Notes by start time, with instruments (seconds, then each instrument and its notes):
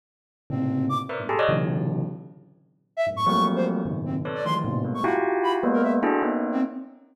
0.50 tubular bells A2 A#2 C3 C#3, flute C4
0.89 flute D6
1.09 tubular bells A#4 B4 C5 D5 E5
1.19 tubular bells G2 G#2 A2 B2
1.29 tubular bells G4 G#4 A4
1.39 tubular bells C#5 D5 D#5
1.49 tubular bells A#2 C3 C#3 D3 E3 F#3
2.97 flute E5
3.07 tubular bells F#2 G#2 A2
3.16 flute C#6
3.26 tubular bells F3 F#3 G3 A3 A#3 C4, flute C#6
3.56 flute C5
3.86 tubular bells F#2 G#2 A#2 B2 C#3 D#3
4.06 flute C4
4.25 tubular bells A4 B4 C#5 D5
4.35 flute D5
4.45 tubular bells D#3 E3 F3 F#3 G#3 A3, flute C6
4.65 tubular bells A2 A#2 B2 C3
4.84 tubular bells G3 G#3 A3 A#3 B3
4.94 flute C#6
5.04 tubular bells E4 F4 F#4 G4, flute F#5
5.43 flute B5
5.63 tubular bells G#3 A#3 B3
5.73 flute A#4
5.83 flute E5
6.03 tubular bells D4 E4 F#4 G#4 A4
6.22 tubular bells A#3 B3 C#4 D#4
6.52 flute C4